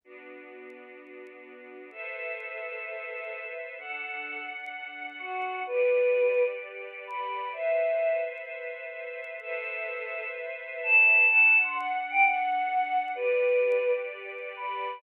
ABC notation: X:1
M:4/4
L:1/16
Q:1/4=128
K:Ador
V:1 name="Choir Aahs"
z16 | A16 | A6 z6 F4 | B8 z4 b4 |
e6 z10 | A8 z4 a4 | a3 c' f2 z g f8 | B8 z4 b4 |]
V:2 name="String Ensemble 1"
[B,DF]16 | [ABce]16 | [DAf]16 | [GABd]16 |
[ABce]16 | [ABce]16 | [DAf]16 | [GABd]16 |]